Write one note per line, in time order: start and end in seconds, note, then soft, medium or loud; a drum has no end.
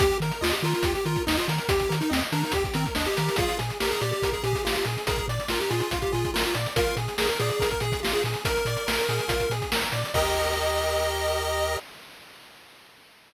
0.00 0.12 D#2 loud
0.00 0.18 G4 loud
0.00 kick loud
0.00 closed hi-hat loud
0.11 closed hi-hat medium
0.20 0.32 D#3 loud
0.20 0.41 A#4 medium
0.20 closed hi-hat medium
0.31 closed hi-hat medium
0.41 0.53 D#2 loud
0.41 0.52 F4 loud
0.41 0.60 D#5 medium
0.41 snare loud
0.53 0.63 G4 medium
0.53 closed hi-hat medium
0.62 0.74 D#3 loud
0.62 0.73 F4 medium
0.62 0.83 A#4 medium
0.62 closed hi-hat medium
0.74 0.93 F4 medium
0.74 closed hi-hat medium
0.83 0.95 D#2 loud
0.83 1.04 G4 medium
0.83 kick loud
0.83 closed hi-hat loud
0.95 1.05 G4 medium
0.95 closed hi-hat medium
1.05 1.17 D#3 medium
1.05 1.23 F4 medium
1.05 1.25 A#4 medium
1.05 closed hi-hat medium
1.16 kick loud
1.16 closed hi-hat medium
1.27 1.39 D#2 loud
1.27 1.37 D#4 medium
1.27 1.46 D#5 medium
1.27 snare loud
1.37 1.47 F4 medium
1.37 closed hi-hat medium
1.48 1.60 D#3 loud
1.48 1.68 A#4 medium
1.48 closed hi-hat loud
1.58 closed hi-hat medium
1.69 1.81 D#2 medium
1.69 1.88 G4 medium
1.69 1.95 G4 medium
1.69 kick loud
1.69 closed hi-hat loud
1.80 kick medium
1.80 closed hi-hat medium
1.89 2.02 D#3 medium
1.89 2.08 A#4 medium
1.89 closed hi-hat loud
2.01 2.11 D#4 medium
2.01 closed hi-hat medium
2.10 2.23 D#2 loud
2.10 2.21 C4 medium
2.10 2.29 D#5 medium
2.10 snare loud
2.21 closed hi-hat medium
2.32 2.44 D#3 medium
2.32 2.42 D4 medium
2.32 2.51 A#4 medium
2.32 closed hi-hat medium
2.43 2.53 D#4 medium
2.43 closed hi-hat medium
2.52 2.65 D#2 medium
2.52 2.64 G4 medium
2.52 2.74 G4 medium
2.52 kick medium
2.52 closed hi-hat loud
2.64 kick loud
2.64 closed hi-hat medium
2.74 2.86 D#3 medium
2.74 2.85 C4 loud
2.74 2.94 A#4 medium
2.74 closed hi-hat loud
2.86 kick loud
2.86 closed hi-hat medium
2.95 3.08 D#2 loud
2.95 3.06 D4 medium
2.95 3.15 D#5 medium
2.95 snare loud
3.05 3.36 G4 medium
3.05 closed hi-hat medium
3.17 3.29 D#3 loud
3.17 3.36 A#4 medium
3.17 closed hi-hat loud
3.29 closed hi-hat medium
3.36 3.49 A#1 loud
3.36 3.57 F4 loud
3.36 3.58 G#4 loud
3.36 kick loud
3.36 closed hi-hat loud
3.49 closed hi-hat medium
3.59 3.71 A#2 medium
3.59 3.78 G#4 medium
3.59 closed hi-hat loud
3.70 closed hi-hat medium
3.80 3.93 A#1 medium
3.80 3.90 G4 medium
3.80 4.01 A#4 medium
3.80 snare loud
3.91 4.01 G#4 loud
3.91 closed hi-hat medium
4.01 4.13 A#2 loud
4.01 4.11 G4 medium
4.01 4.21 D5 medium
4.01 closed hi-hat medium
4.12 4.30 G4 medium
4.12 closed hi-hat medium
4.22 4.34 A#1 medium
4.22 4.42 A#4 medium
4.22 kick loud
4.22 closed hi-hat loud
4.32 4.43 G#4 medium
4.32 kick medium
4.32 closed hi-hat medium
4.43 4.55 A#2 medium
4.43 4.62 G4 medium
4.43 4.64 G#4 medium
4.43 closed hi-hat medium
4.53 kick loud
4.53 closed hi-hat medium
4.65 4.77 A#1 medium
4.65 4.84 F4 medium
4.65 4.75 G4 medium
4.65 snare loud
4.75 4.85 G4 medium
4.75 closed hi-hat loud
4.85 4.97 A#2 loud
4.85 5.06 G#4 medium
4.85 closed hi-hat medium
4.98 closed hi-hat medium
5.07 5.20 A#1 loud
5.07 5.26 G#4 loud
5.07 5.26 A#4 medium
5.07 kick loud
5.07 closed hi-hat loud
5.16 kick loud
5.16 closed hi-hat medium
5.28 5.39 A#2 loud
5.28 5.48 D5 medium
5.28 closed hi-hat medium
5.40 closed hi-hat medium
5.48 5.61 A#1 medium
5.48 5.59 F4 medium
5.48 5.69 A#4 medium
5.48 snare loud
5.60 5.70 G4 medium
5.60 closed hi-hat medium
5.70 5.82 A#2 loud
5.70 5.80 F4 medium
5.70 5.89 G#4 medium
5.70 closed hi-hat medium
5.80 5.99 F4 medium
5.80 closed hi-hat medium
5.91 6.03 A#1 loud
5.91 6.11 F4 medium
5.91 kick loud
5.91 closed hi-hat loud
6.02 6.12 G4 medium
6.02 kick medium
6.02 closed hi-hat medium
6.12 6.25 A#2 medium
6.12 6.31 F4 medium
6.12 6.31 G#4 medium
6.12 closed hi-hat medium
6.25 kick loud
6.25 closed hi-hat medium
6.34 6.46 A#1 medium
6.34 6.44 F4 medium
6.34 6.53 A#4 medium
6.34 snare loud
6.44 6.54 F4 medium
6.44 closed hi-hat medium
6.54 6.67 A#2 loud
6.54 6.74 D5 medium
6.54 closed hi-hat loud
6.66 closed hi-hat medium
6.76 6.88 A#1 loud
6.76 6.96 F4 loud
6.76 6.96 A#4 loud
6.76 kick loud
6.76 closed hi-hat loud
6.86 closed hi-hat medium
6.97 7.08 A#2 loud
6.97 7.17 G#4 medium
6.97 closed hi-hat medium
7.08 closed hi-hat medium
7.18 7.30 A#1 loud
7.18 7.28 G#4 medium
7.18 7.38 A#4 medium
7.18 snare loud
7.29 7.39 A#4 medium
7.29 closed hi-hat medium
7.39 7.51 A#2 loud
7.39 7.49 G#4 loud
7.39 7.59 D5 medium
7.39 closed hi-hat medium
7.49 7.70 G#4 medium
7.49 closed hi-hat medium
7.60 7.72 A#1 loud
7.60 7.79 A#4 medium
7.60 kick loud
7.60 closed hi-hat loud
7.70 7.81 A#4 medium
7.70 kick medium
7.70 closed hi-hat medium
7.80 7.93 A#2 loud
7.80 8.00 G#4 medium
7.80 8.01 G#4 medium
7.80 closed hi-hat medium
7.92 kick loud
7.92 closed hi-hat medium
8.03 8.15 A#1 loud
8.03 8.22 F4 medium
8.03 8.13 G4 medium
8.03 snare loud
8.12 8.23 G#4 loud
8.12 closed hi-hat medium
8.24 8.36 A#2 loud
8.24 8.44 G#4 medium
8.24 closed hi-hat medium
8.34 closed hi-hat medium
8.45 8.58 A#1 loud
8.45 9.53 A#4 loud
8.45 8.64 A#4 medium
8.45 kick loud
8.45 closed hi-hat loud
8.57 closed hi-hat medium
8.65 8.77 A#2 loud
8.65 8.86 D5 medium
8.65 closed hi-hat medium
8.77 closed hi-hat medium
8.87 8.99 A#1 medium
8.87 9.06 A#4 medium
8.87 snare loud
8.99 closed hi-hat medium
9.09 9.20 A#2 loud
9.09 9.28 G#4 medium
9.09 closed hi-hat medium
9.19 closed hi-hat medium
9.28 9.40 A#1 loud
9.28 9.47 F4 medium
9.28 kick loud
9.28 closed hi-hat loud
9.40 kick medium
9.40 closed hi-hat medium
9.50 9.61 A#2 medium
9.50 9.71 G#4 medium
9.50 closed hi-hat medium
9.62 kick medium
9.62 closed hi-hat medium
9.72 9.84 A#1 medium
9.72 9.91 A#4 medium
9.72 snare loud
9.82 closed hi-hat medium
9.92 10.04 A#2 medium
9.92 10.12 D5 medium
9.92 closed hi-hat loud
10.05 closed hi-hat medium
10.14 11.77 D#2 loud
10.14 11.78 G4 loud
10.14 11.78 A#4 loud
10.14 11.77 D#5 loud
10.14 11.78 D#5 loud
10.14 kick loud
10.14 crash loud